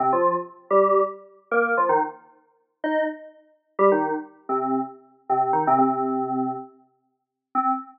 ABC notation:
X:1
M:4/4
L:1/16
Q:1/4=127
K:Cdor
V:1 name="Electric Piano 2"
[C,C] [F,F]2 z3 [G,G]3 z4 [B,B]2 [F,F] | [E,E] z7 [Ee]2 z6 | [G,G] [E,E]2 z3 [C,C]3 z4 [C,C]2 [E,E] | [C,C] [C,C]7 z8 |
C4 z12 |]